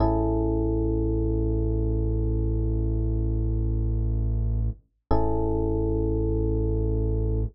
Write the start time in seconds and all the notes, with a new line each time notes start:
0.00 A1 C#4 E4 G#4 A4
5.11 A1 C#4 E4 G#4 A4